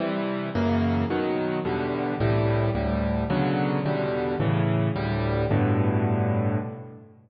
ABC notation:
X:1
M:6/8
L:1/8
Q:3/8=109
K:G
V:1 name="Acoustic Grand Piano"
[C,E,G,]3 [F,,^C,E,^A,]3 | [B,,^D,F,]3 [E,,B,,=D,G,]3 | [C,,A,,E,G,]3 [D,,A,,G,]3 | [B,,^C,D,F,]3 [E,,B,,D,G,]3 |
[A,,^C,E,]3 [D,,A,,G,]3 | [G,,A,,B,,D,]6 |]